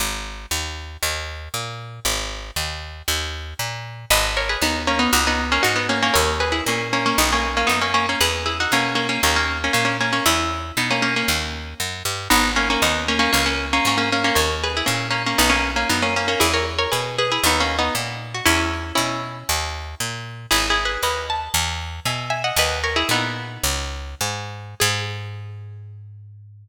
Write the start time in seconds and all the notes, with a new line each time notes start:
0.00 G#1
0.51 D#2
1.03 D#2
1.54 A#2
2.05 G#1
2.56 D#2
3.08 D#2
3.59 A#2
4.10 G#1 B4 D#5
4.37 A#4 C#5
4.49 G#4 B4
4.62 D#2 B3 D#4
4.87 A#3 C#4
4.99 B3 D#4
5.13 C#2 D#4 F#4
5.27 B3 D#4
5.52 A#3 C#4
5.63 G#2 D#4 F#4
5.76 B3 D#4
5.89 A#3 C#4
6.02 A#3 C#4
6.14 D#2 A#4 C#5
6.40 G#4 B4
6.52 E4 G#4
6.66 A#2 A#3 C#4
6.93 A#3 C#4
7.06 A#3 C#4
7.18 B1 B3 D#4
7.33 A#3 C#4
7.57 A#3 C#4
7.67 F#2 B3 D#4
7.81 A#3 C#4
7.94 A#3 C#4
8.09 A#3 C#4
8.21 E2 G#4 B4
8.46 E4 G#4
8.60 D#4 F#4
8.72 B2 A#3 C#4
8.95 A#3 C#4
9.09 A#3 C#4
9.23 D#2 A#3 C#4
9.36 A#3 C#4
9.64 A#3 C#4
9.73 A#2 A#3 C#4
9.85 A#3 C#4
10.01 A#3 C#4
10.13 A#3 C#4
10.26 E2 C#4 E4
10.77 B2 B3 D#4
10.90 A#3 C#4
11.02 A#3 C#4
11.16 A#3 C#4
11.28 D#2
11.80 F#2
12.05 G2
12.30 G#1 B3 D#4
12.56 A#3 C#4
12.70 A#3 C#4
12.82 D#2 B3 D#4
13.08 A#3 C#4
13.19 A#3 C#4
13.33 C#2 A#3 C#4
13.46 A#3 C#4
13.73 A#3 C#4
13.85 G#2 A#3 C#4
13.98 A#3 C#4
14.12 A#3 C#4
14.24 A#3 C#4
14.35 D#2 A#4 C#5
14.63 G#4 B4
14.77 E4 G#4
14.86 A#2 A#3 C#4
15.10 A#3 C#4
15.26 A#3 C#4
15.38 B1 B3 D#4
15.50 A#3 C#4
15.76 A#3 C#4
15.89 F#2 B3 D#4
16.02 A#3 C#4
16.16 A#3 C#4
16.28 A#3 C#4
16.40 E2 E4 G#4
16.54 A#4 C#5
16.79 A#4 C#5
16.92 B2 G#4 B4
17.18 G#4 B4
17.32 E4 G#4
17.43 D#2 B3 D#4
17.60 A#3 C#4
17.79 B3 D#4
17.95 A#2
18.34 F#4
18.46 E2 C#4 E4
18.95 B2 C#4 E4
19.49 D#2
20.00 A#2
20.51 G#1 E4 G#4
20.70 E4 G#4
20.85 G#4 B4
21.03 D#2 B4 D#5
21.30 A5
21.54 E2
22.05 B2 E5 G#5
22.30 E5 G#5
22.44 D#5 F#5
22.56 D#2 B4 D#5
22.84 A#4 C#5
22.96 E4 G#4
23.09 A#2 B3 D#4
23.63 C#2
24.21 G#2
24.80 G#2 G#4